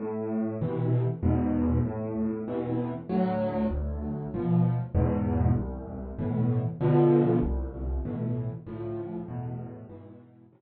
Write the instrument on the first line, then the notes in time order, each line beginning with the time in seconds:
acoustic grand piano
0.00 A2
0.61 B2 C3 E3
1.23 E2 G#2 B2
1.85 A2
2.48 B2 C3 E3
3.09 D2 A2 F#3
3.71 D2
4.34 B2 F3
4.95 E2 G#2 B2
5.55 C2
6.19 A2 B2 E3
6.81 B2 D3 F3
7.42 C2
8.05 A2 B2 E3
8.66 D2 A2 F3
9.28 E2 A2 B2
9.89 G#2 B2 E3
10.52 A2 B2 C3 E3